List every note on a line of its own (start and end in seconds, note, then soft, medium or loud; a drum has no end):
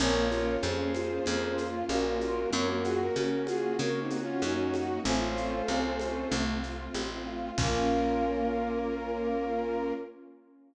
0.00 0.57 A#1 loud
0.00 2.50 A#3 loud
0.00 0.29 A#3 loud
0.00 0.26 C#4 medium
0.00 2.50 C#4 loud
0.00 2.50 F4 loud
0.00 0.54 A#4 medium
0.00 0.54 C#5 medium
0.00 crash loud
0.00 low conga loud
0.00 shaker medium
0.31 0.60 F4 loud
0.31 high conga medium
0.31 shaker medium
0.62 1.20 F2 loud
0.62 0.90 C#4 medium
0.62 1.64 G#4 medium
0.62 1.64 C5 medium
0.62 high conga medium
0.62 shaker medium
0.95 1.25 F4 medium
0.95 high conga medium
0.95 shaker medium
1.26 1.84 F2 loud
1.26 1.56 A#3 loud
1.26 2.42 F4 medium
1.26 low conga medium
1.26 shaker medium
1.57 1.85 F4 medium
1.57 shaker medium
1.88 2.46 A#1 medium
1.88 2.17 C#4 medium
1.88 2.50 F#4 medium
1.88 2.50 A#4 medium
1.88 high conga medium
1.88 shaker medium
2.21 2.51 F4 medium
2.21 high conga medium
2.21 shaker medium
2.51 3.10 F#2 loud
2.51 2.79 A#3 loud
2.51 5.03 A#3 loud
2.51 5.03 C#4 loud
2.51 5.03 F#4 medium
2.51 2.68 A#4 medium
2.51 2.81 C#5 medium
2.51 2.68 C#5 medium
2.51 low conga loud
2.51 shaker medium
2.69 2.84 F#4 medium
2.69 2.84 A#4 medium
2.84 2.99 F4 medium
2.84 3.13 F#4 medium
2.84 2.99 G#4 medium
2.84 shaker medium
3.00 3.15 F#4 medium
3.00 3.15 A#4 medium
3.16 3.73 C#3 medium
3.16 3.45 C#4 medium
3.16 3.43 F#4 medium
3.16 3.43 A#4 medium
3.16 high conga medium
3.16 shaker medium
3.47 3.76 F4 medium
3.47 3.76 F#4 medium
3.47 3.76 G#4 medium
3.47 high conga medium
3.47 shaker medium
3.79 4.36 C#3 medium
3.79 4.08 A#3 loud
3.79 3.99 F#4 medium
3.79 3.99 A#4 medium
3.79 5.03 C#5 medium
3.79 low conga medium
3.79 shaker medium
4.00 4.20 C4 medium
4.00 4.20 D#4 medium
4.10 4.40 F#4 medium
4.10 high conga medium
4.10 shaker medium
4.21 4.41 C#4 medium
4.21 4.41 F4 medium
4.42 4.99 F#2 medium
4.42 4.71 C#4 medium
4.42 4.99 D#4 medium
4.42 4.99 F#4 medium
4.42 high conga medium
4.42 shaker medium
4.74 5.02 F#4 medium
4.74 high conga medium
4.74 shaker medium
5.04 5.62 A1 loud
5.04 5.33 A3 loud
5.04 7.55 A3 medium
5.04 7.55 C4 loud
5.04 5.93 C#4 medium
5.04 7.55 F4 loud
5.04 5.93 F4 medium
5.04 6.35 A4 medium
5.04 6.35 C5 medium
5.04 low conga loud
5.04 shaker medium
5.35 5.64 F4 medium
5.35 shaker medium
5.68 6.25 C2 medium
5.68 5.97 C4 medium
5.68 high conga medium
5.68 shaker medium
5.99 6.29 C#4 medium
5.99 6.29 F4 medium
5.99 high conga medium
5.99 shaker medium
6.31 6.89 C2 loud
6.31 6.60 A3 loud
6.31 6.58 A3 medium
6.31 low conga loud
6.31 shaker medium
6.63 6.91 F4 medium
6.63 shaker medium
6.94 7.51 A1 medium
6.94 7.23 C4 medium
6.94 high conga medium
6.94 shaker medium
7.27 7.55 F4 medium
7.58 9.93 A#1 loud
7.58 9.93 A#3 medium
7.58 9.93 A#3 loud
7.58 9.94 A#3 loud
7.58 9.93 C#4 medium
7.58 9.93 C#4 loud
7.58 9.93 F4 loud
7.58 9.93 F4 medium
7.58 9.93 A#4 loud
7.58 kick loud
7.58 crash loud